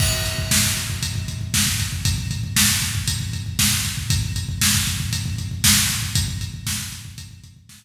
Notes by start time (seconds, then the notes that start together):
0.00 kick, crash
0.13 kick
0.26 kick, closed hi-hat
0.38 kick
0.51 kick, snare
0.64 kick
0.77 kick, closed hi-hat
0.90 kick
1.03 kick, closed hi-hat
1.15 kick
1.28 kick, closed hi-hat
1.41 kick
1.54 kick, snare
1.67 kick
1.80 kick, closed hi-hat
1.92 kick
2.05 kick, closed hi-hat
2.18 kick
2.31 kick, closed hi-hat
2.44 kick
2.56 kick, snare
2.69 kick
2.82 kick, closed hi-hat
2.95 kick
3.08 kick, closed hi-hat
3.20 kick
3.33 kick, closed hi-hat
3.46 kick
3.59 kick, snare
3.72 kick
3.85 kick, closed hi-hat
3.97 kick
4.10 kick, closed hi-hat
4.23 kick
4.36 kick, closed hi-hat
4.49 kick
4.61 kick, snare
4.74 kick
4.87 kick, closed hi-hat
5.00 kick
5.13 kick, closed hi-hat
5.26 kick
5.38 kick, closed hi-hat
5.51 kick
5.64 kick, snare
5.77 kick
5.90 kick, closed hi-hat
6.03 kick
6.15 kick, closed hi-hat
6.28 kick
6.41 kick, closed hi-hat
6.54 kick
6.67 kick, snare
6.79 kick
6.92 kick, closed hi-hat
7.05 kick
7.18 kick, closed hi-hat
7.31 kick
7.44 kick, closed hi-hat
7.56 kick
7.69 kick, snare
7.82 kick